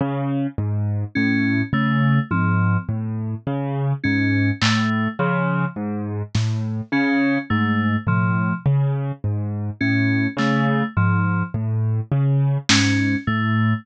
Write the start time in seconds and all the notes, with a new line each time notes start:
0.00 C#3
0.58 G#2
1.15 A2 C#4
1.73 C#3 A3
2.31 G#2 F3, high tom
2.88 A2
3.47 C#3
4.04 G#2 C#4
4.62 A2 A3, clap
5.19 C#3 F3
5.76 G#2
6.35 A2, snare
6.92 C#3 C#4
7.50 G#2 A3
8.06 A2 F3, floor tom
8.66 C#3
9.24 G#2
9.81 A2 C#4
10.37 C#3 A3, clap
10.97 G#2 F3
11.54 A2
12.12 C#3
12.69 G#2 C#4, snare
13.27 A2 A3